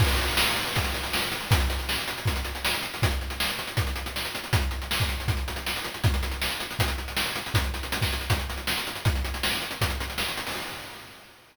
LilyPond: \new DrumStaff \drummode { \time 4/4 \tempo 4 = 159 <cymc bd>16 hh16 hh16 hh16 sn16 hh16 hh16 hh16 <hh bd>16 hh16 hh16 hh16 sn16 hh16 hh16 hh16 | <hh bd>16 hh16 hh16 hh16 sn16 hh16 hh16 hh16 <hh bd>16 hh16 hh16 hh16 sn16 hh16 hh16 hh16 | <hh bd>16 hh16 hh16 hh16 sn16 hh16 hh16 hh16 <hh bd>16 hh16 hh16 hh16 sn16 hh16 hh16 hh16 | <hh bd>16 hh16 hh16 hh16 sn16 <hh bd>16 hh16 hh16 <hh bd>16 hh16 hh16 hh16 sn16 hh16 hh16 hh16 |
<hh bd>16 hh16 hh16 hh16 sn16 hh16 hh16 hh16 <hh bd>16 hh16 hh16 hh16 sn16 hh16 hh16 hh16 | <hh bd>16 hh16 hh16 hh16 hh16 <bd sn>16 hh16 hh16 <hh bd>16 hh16 hh16 hh16 sn16 hh16 hh16 hh16 | <hh bd>16 hh16 hh16 hh16 sn16 hh16 hh16 hh16 <hh bd>16 hh16 hh16 hh16 sn16 hh16 hh16 hho16 | }